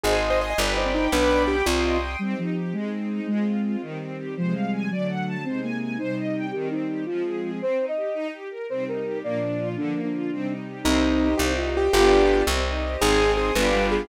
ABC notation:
X:1
M:6/8
L:1/16
Q:3/8=111
K:Cm
V:1 name="Acoustic Grand Piano"
A A z c e e G2 E C E2 | =B4 G2 F4 z2 | z12 | z12 |
z12 | z12 | z12 | z12 |
z12 | z12 | E6 G4 G2 | G6 z6 |
A4 A2 =B4 A2 |]
V:2 name="Flute"
e6 d2 c4 | D6 C4 z2 | G,2 F,4 A,6 | A,6 z6 |
F,2 G,4 ^F,6 | C2 B,4 E6 | G2 E4 F6 | c3 e5 z4 |
c2 B4 d6 | D3 D7 z2 | C6 E2 F4 | F4 z8 |
E6 =B,2 G,4 |]
V:3 name="String Ensemble 1"
c2 e2 a2 =B2 d2 g2 | =B2 d2 g2 c2 e2 g2 | C2 E2 G2 A,2 C2 E2 | A,2 F2 F2 E,2 C2 G2 |
c2 f2 a2 d2 ^f2 =a2 | c2 a2 a2 c2 e2 g2 | E,2 C2 G2 F,2 A2 A2 | C2 E2 G2 E2 G2 B2 |
C2 E2 G2 B,2 D2 F2 | D,2 B,2 F2 C2 E2 G2 | C2 E2 G2 C2 E2 G2 | [=B,DFG]6 C2 E2 G2 |
C2 E2 A2 [=B,DFG]6 |]
V:4 name="Electric Bass (finger)" clef=bass
A,,,6 G,,,6 | =B,,,6 C,,6 | z12 | z12 |
z12 | z12 | z12 | z12 |
z12 | z12 | C,,6 C,,6 | G,,,6 C,,6 |
A,,,6 G,,,6 |]
V:5 name="String Ensemble 1"
[ac'e']6 [g=bd']6 | [g=bd']6 [gc'e']6 | [CEG]6 [A,CE]6 | [A,CF]6 [E,G,C]6 |
[C,F,A,]6 [D,^F,=A,]6 | [C,A,E]6 [C,G,E]6 | [E,G,C]6 [F,A,C]6 | z12 |
[C,G,E]6 [B,,F,D]6 | [D,F,B,]6 [C,G,E]6 | [Gce]6 [Gce]6 | [FG=Bd]6 [Gce]6 |
[ac'e']6 [fg=bd']6 |]